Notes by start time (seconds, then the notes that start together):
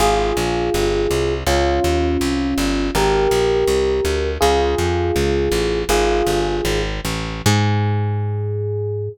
0.00 G#1 F4 G#4
0.37 A#1
0.74 G1
1.11 C2
1.47 C#2 C#4 F4
1.84 D#2
2.21 C2
2.58 G1
2.95 G#1 G4 A#4
3.31 A#1
3.67 C2
4.05 D2
4.41 C#2 F4 G#4
4.78 F2
5.16 C#2
5.52 A1
5.89 G#1 F4 G#4
6.27 G1
6.65 G#1
7.05 A1
7.46 G#2 G#4